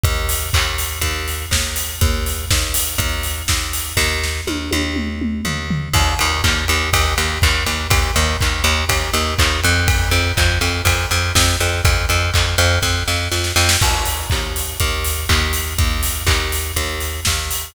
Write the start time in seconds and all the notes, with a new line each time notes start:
0.04 D#2, kick, closed hi-hat
0.29 open hi-hat
0.53 D#2, kick, clap
0.78 open hi-hat
1.01 D#2, kick, closed hi-hat
1.28 open hi-hat
1.51 D#2, kick, snare
1.76 open hi-hat
2.01 D#2, kick, closed hi-hat
2.26 open hi-hat
2.51 D#2, kick, snare
2.74 open hi-hat
2.98 D#2, kick, closed hi-hat
3.23 open hi-hat
3.48 D#2, kick, snare
3.73 open hi-hat
3.97 D#2, kick, snare
4.24 snare
4.47 D#2, high tom
4.71 D#2, high tom
4.96 mid tom
5.22 mid tom
5.45 D#2, floor tom
5.70 floor tom
5.94 D#2, kick, crash
6.19 D#2, ride
6.44 D#2, kick, clap
6.68 D#2, ride
6.93 D#2, kick, ride
7.18 D#2, ride
7.42 D#2, kick, clap
7.66 D#2, ride
7.90 D#2, kick, ride
8.16 D#2, ride
8.41 D#2, kick, clap
8.64 D#2, ride
8.89 D#2, kick, ride
9.14 D#2, ride
9.39 D#2, kick, clap
9.64 F2, ride
9.88 kick, ride
10.11 F2, ride
10.37 F2, kick, clap
10.61 F2, ride
10.85 F2, kick, ride
11.11 F2, ride
11.35 F2, kick, snare
11.60 F2, ride
11.85 F2, kick, ride
12.09 F2, ride
12.34 F2, kick, clap
12.58 F2, ride
12.82 F2, kick, snare
13.08 F2, snare
13.32 F2, snare
13.44 snare
13.56 F2, snare
13.69 snare
13.81 D#2, kick, crash
14.06 open hi-hat
14.30 D#2, kick, clap
14.56 open hi-hat
14.80 D#2, kick, closed hi-hat
15.05 open hi-hat
15.29 D#2, kick, clap
15.53 open hi-hat
15.78 D#2, kick, closed hi-hat
16.03 open hi-hat
16.27 D#2, kick, clap
16.52 open hi-hat
16.76 D#2, kick, closed hi-hat
17.01 open hi-hat
17.25 D#2, kick, snare
17.51 open hi-hat